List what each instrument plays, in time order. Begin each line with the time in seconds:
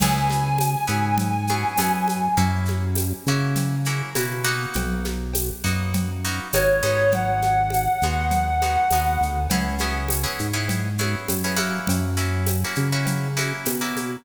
0.00 synth bass 1 C#2, acoustic guitar (steel) B3 C#4 E4 G#4, clarinet G#5, crash, cowbell, low conga, shaker
0.30 snare, high conga, shaker
0.58 tambourine, cowbell, high conga, shaker
0.87 synth bass 1 G#2, acoustic guitar (steel) B3 C#4 E4 G#4, high conga, shaker
1.18 cowbell, low conga, shaker
1.47 acoustic guitar (steel) B3 C#4 E4 G#4, high conga, shaker
1.77 synth bass 1 F#2, acoustic guitar (steel) B3 C#4 E4 G#4, tambourine, cowbell, high conga, shaker
2.08 high conga, shaker
2.37 synth bass 1 F#2, acoustic guitar (steel) A#3 C#4 E4 F#4, cowbell, low conga, shaker
2.65 snare, high conga, shaker
2.95 tambourine, cowbell, high conga, shaker
3.26 synth bass 1 C#3, acoustic guitar (steel) A#3 C#4 E4 F#4, shaker
3.55 cowbell, low conga, shaker
3.85 acoustic guitar (steel) A#3 C#4 E4 F#4, shaker
4.15 synth bass 1 B2, acoustic guitar (steel) A#3 C#4 E4 F#4, tambourine, cowbell, high conga, shaker
4.44 acoustic guitar (steel) A#3 B3 D#4 F#4, shaker
4.74 synth bass 1 B1, cowbell, low conga, shaker
5.05 snare, high conga, shaker
5.33 tambourine, cowbell, high conga, shaker
5.64 synth bass 1 F#2, acoustic guitar (steel) A#3 B3 D#4 F#4, shaker
5.94 cowbell, low conga, shaker
6.24 acoustic guitar (steel) A#3 B3 D#4 F#4, shaker
6.52 synth bass 1 G#1, acoustic guitar (steel) A#3 B3 D#4 F#4, clarinet C#5, tambourine, cowbell, high conga, shaker
6.83 synth bass 1 G#1, acoustic guitar (steel) G#3 B3 D#4 F#4, high conga, shaker
7.11 clarinet F#5, cowbell, low conga, shaker
7.42 snare, high conga, shaker
7.70 tambourine, cowbell, high conga, shaker
8.01 synth bass 1 D#2, acoustic guitar (steel) G#3 B3 D#4 F#4, high conga, shaker
8.31 cowbell, low conga, shaker
8.62 acoustic guitar (steel) G#3 B3 D#4 F#4, high conga, shaker
8.90 synth bass 1 D#2, acoustic guitar (steel) G#3 B3 D#4 F#4, tambourine, cowbell, high conga, shaker
9.21 synth bass 1 D2, shaker
9.50 synth bass 1 C#2, acoustic guitar (steel) B3 C#4 E4 G#4, cowbell, low conga, shaker
9.78 acoustic guitar (steel) B3 C#4 E4 G#4, snare, high conga, shaker
10.08 tambourine, cowbell, high conga, shaker
10.23 acoustic guitar (steel) B3 C#4 E4 G#4
10.39 synth bass 1 G#2, shaker
10.53 acoustic guitar (steel) B3 C#4 E4 G#4
10.68 cowbell, low conga, shaker
10.98 acoustic guitar (steel) B3 C#4 E4 G#4, high conga, shaker
11.28 synth bass 1 F#2, tambourine, cowbell, high conga, shaker
11.44 acoustic guitar (steel) B3 C#4 E4 G#4
11.56 acoustic guitar (steel) A#3 C#4 E4 F#4, high conga, shaker
11.87 synth bass 1 F#2, cowbell, low conga, shaker
12.17 acoustic guitar (steel) A#3 C#4 E4 F#4, snare, shaker
12.46 tambourine, cowbell, high conga, shaker
12.64 acoustic guitar (steel) A#3 C#4 E4 F#4
12.75 synth bass 1 C#3, high conga, shaker
12.92 acoustic guitar (steel) A#3 C#4 E4 F#4
13.05 cowbell, low conga, shaker
13.37 acoustic guitar (steel) A#3 C#4 E4 F#4, high conga, shaker
13.65 synth bass 1 B2, tambourine, cowbell, high conga, shaker
13.81 acoustic guitar (steel) A#3 C#4 E4 F#4
13.96 high conga, shaker